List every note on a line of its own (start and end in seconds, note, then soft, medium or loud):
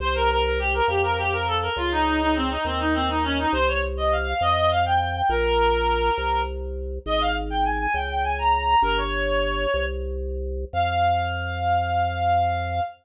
0.00 0.81 C2 loud
0.00 0.14 C5 loud
0.15 0.29 A#4 loud
0.29 0.43 A#4 loud
0.44 0.58 A#4 loud
0.59 0.73 G4 loud
0.74 0.87 A#4 loud
0.88 1.69 F2 loud
0.88 1.02 G4 loud
1.03 1.17 A#4 loud
1.18 1.32 G4 loud
1.32 1.46 A#4 medium
1.47 1.61 A4 loud
1.62 1.76 A#4 medium
1.76 2.58 C#2 loud
1.76 1.90 F4 loud
1.91 2.05 D#4 loud
2.06 2.20 D#4 loud
2.21 2.35 D#4 loud
2.35 2.49 C4 loud
2.50 2.64 D#4 medium
2.65 3.46 D#2 loud
2.65 2.79 C4 loud
2.79 2.93 D#4 loud
2.94 3.08 C4 loud
3.09 3.23 D#4 loud
3.24 3.37 C#4 loud
3.38 3.52 D#4 loud
3.53 4.34 C2 loud
3.53 3.67 C5 loud
3.68 3.82 C#5 loud
3.97 4.11 D#5 loud
4.12 4.26 F5 loud
4.26 4.40 F5 loud
4.41 5.22 F2 loud
4.41 4.55 D#5 loud
4.56 4.70 D#5 loud
4.71 4.85 F5 loud
4.85 4.99 G5 loud
5.00 5.14 G5 loud
5.15 5.29 G5 loud
5.29 6.11 A#1 loud
5.29 6.40 A#4 loud
6.18 6.99 C2 loud
7.06 7.87 G#1 loud
7.06 7.20 D#5 loud
7.21 7.35 F5 loud
7.50 7.64 G5 loud
7.65 7.79 G#5 loud
7.79 7.93 G#5 loud
7.94 8.75 C#2 loud
7.94 8.08 G5 loud
8.09 8.23 G5 medium
8.24 8.37 G#5 loud
8.38 8.52 A#5 loud
8.53 8.67 A#5 loud
8.68 8.82 A#5 loud
8.82 9.66 G1 loud
8.82 8.96 A#4 loud
8.97 9.84 C#5 loud
9.74 10.65 C2 loud
10.73 12.80 F2 loud
10.73 12.80 F5 loud